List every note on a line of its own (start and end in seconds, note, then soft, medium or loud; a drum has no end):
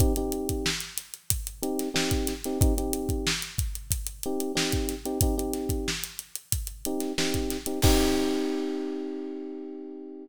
0.00 0.13 C4 medium
0.00 0.13 D#4 medium
0.00 0.13 G4 medium
0.00 kick loud
0.00 closed hi-hat medium
0.16 0.69 C4 medium
0.16 0.69 D#4 medium
0.16 0.69 G4 medium
0.16 closed hi-hat medium
0.32 closed hi-hat medium
0.49 kick medium
0.49 closed hi-hat medium
0.66 snare loud
0.80 closed hi-hat medium
0.97 snare soft
0.97 closed hi-hat medium
1.14 closed hi-hat medium
1.30 kick medium
1.30 closed hi-hat loud
1.47 closed hi-hat medium
1.63 1.89 C4 medium
1.63 1.89 D#4 medium
1.63 1.89 G4 medium
1.63 closed hi-hat medium
1.79 snare soft
1.79 closed hi-hat medium
1.94 2.33 C4 medium
1.94 2.33 D#4 medium
1.94 2.33 G4 medium
1.94 snare loud
2.11 kick medium
2.11 closed hi-hat medium
2.27 snare medium
2.27 closed hi-hat medium
2.44 2.59 C4 medium
2.44 2.59 D#4 medium
2.44 2.59 G4 medium
2.44 snare soft
2.44 closed hi-hat medium
2.61 2.74 C4 medium
2.61 2.74 D#4 medium
2.61 2.74 G4 medium
2.61 kick loud
2.61 closed hi-hat medium
2.78 3.30 C4 medium
2.78 3.30 D#4 medium
2.78 3.30 G4 medium
2.78 closed hi-hat medium
2.93 closed hi-hat medium
3.09 kick medium
3.09 closed hi-hat medium
3.27 snare loud
3.42 closed hi-hat medium
3.58 kick medium
3.58 closed hi-hat medium
3.75 closed hi-hat medium
3.91 kick medium
3.91 closed hi-hat loud
4.07 closed hi-hat medium
4.23 4.52 C4 medium
4.23 4.52 D#4 medium
4.23 4.52 G4 medium
4.23 closed hi-hat medium
4.40 closed hi-hat medium
4.55 4.95 C4 medium
4.55 4.95 D#4 medium
4.55 4.95 G4 medium
4.55 snare loud
4.72 kick medium
4.72 closed hi-hat medium
4.89 snare soft
4.89 closed hi-hat medium
5.05 5.18 C4 medium
5.05 5.18 D#4 medium
5.05 5.18 G4 medium
5.05 closed hi-hat medium
5.21 5.35 C4 medium
5.21 5.35 D#4 medium
5.21 5.35 G4 medium
5.21 kick loud
5.21 closed hi-hat loud
5.38 5.90 C4 medium
5.38 5.90 D#4 medium
5.38 5.90 G4 medium
5.38 closed hi-hat medium
5.53 snare soft
5.53 closed hi-hat medium
5.69 kick medium
5.69 closed hi-hat medium
5.88 snare medium
6.04 closed hi-hat medium
6.19 closed hi-hat medium
6.35 closed hi-hat medium
6.52 kick medium
6.52 closed hi-hat loud
6.67 closed hi-hat medium
6.85 7.12 C4 medium
6.85 7.12 D#4 medium
6.85 7.12 G4 medium
6.85 closed hi-hat medium
7.00 snare soft
7.00 closed hi-hat medium
7.18 7.57 C4 medium
7.18 7.57 D#4 medium
7.18 7.57 G4 medium
7.18 snare loud
7.34 kick medium
7.34 closed hi-hat medium
7.50 snare medium
7.50 closed hi-hat medium
7.66 7.79 C4 medium
7.66 7.79 D#4 medium
7.66 7.79 G4 medium
7.66 closed hi-hat medium
7.82 10.26 C4 loud
7.82 10.26 D#4 loud
7.82 10.26 G4 loud
7.82 kick loud
7.82 crash loud